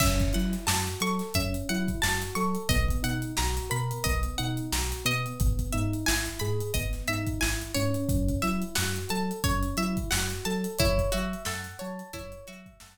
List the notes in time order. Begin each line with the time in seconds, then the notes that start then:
0.00 F#2 C#4 E5, kick, crash
0.20 kick, snare, closed hi-hat
0.33 F#3 E4 F#5, snare, closed hi-hat
0.53 snare, closed hi-hat
0.67 F#2 F#4 A5, snare
0.87 closed hi-hat
1.00 F#3 A4 C#6, closed hi-hat
1.19 snare, closed hi-hat
1.34 F#2 C#4 E5, kick, closed hi-hat
1.54 closed hi-hat
1.69 F#3 E4 F#5, closed hi-hat
1.88 kick, closed hi-hat
2.02 F#2 F#4 A5, snare
2.22 closed hi-hat
2.35 F#3 A4 C#6, closed hi-hat
2.55 closed hi-hat
2.69 B1 B3 D#5, kick, closed hi-hat
2.88 kick, closed hi-hat
3.03 B2 D#4 F#5, closed hi-hat
3.22 closed hi-hat
3.37 B1 F#4 A#5, snare
3.57 snare, closed hi-hat
3.70 B2 A#4 B5, closed hi-hat
3.91 closed hi-hat
4.04 B1 B3 D#5, kick, closed hi-hat
4.23 closed hi-hat
4.38 B2 D#4 F#5, closed hi-hat
4.57 closed hi-hat
4.72 B1 F#4 A#5, snare
4.92 closed hi-hat
5.05 B2 B3 D#5, closed hi-hat
5.26 closed hi-hat
5.40 G#1, kick, closed hi-hat
5.59 kick, closed hi-hat
5.72 G#2 D#4 E5, closed hi-hat
5.93 closed hi-hat
6.06 G#1 E4 G#5, snare
6.26 closed hi-hat
6.39 G#2 G#4 B5, closed hi-hat
6.61 closed hi-hat
6.74 G#1 B3 D#5, kick, closed hi-hat
6.93 snare, closed hi-hat
7.08 G#2 D#4 E5, closed hi-hat
7.27 kick, closed hi-hat
7.40 G#1 E4 G#5, snare
7.62 closed hi-hat
7.74 G#2 C#4 C#5, closed hi-hat
7.94 closed hi-hat
8.09 F#2, kick, closed hi-hat
8.29 kick, closed hi-hat
8.42 F#3 E4 E5, snare, closed hi-hat
8.62 closed hi-hat
8.75 F#2 F#4 F#5, snare
8.96 closed hi-hat
9.09 F#3 A4 A5, closed hi-hat
9.31 closed hi-hat
9.44 F#2 C#4 C#5, kick, closed hi-hat
9.63 closed hi-hat
9.77 F#3 E4 E5, closed hi-hat
9.97 kick, closed hi-hat
10.10 F#2 F#4 F#5, snare
10.30 closed hi-hat
10.45 F#3 A4 A5, closed hi-hat
10.64 closed hi-hat
10.79 F#2 E4 C#5, kick, closed hi-hat
10.98 kick, closed hi-hat
11.12 F#3 F#4 E5, closed hi-hat
11.33 closed hi-hat
11.45 F#2 A4 F#5, snare
11.64 closed hi-hat
11.79 F#3 C#5 A5, closed hi-hat
11.99 closed hi-hat
12.13 F#2 E4 C#5, kick, closed hi-hat
12.32 closed hi-hat
12.47 F#3 F#4 E5, closed hi-hat
12.66 kick, closed hi-hat
12.80 F#2 A4 F#5, snare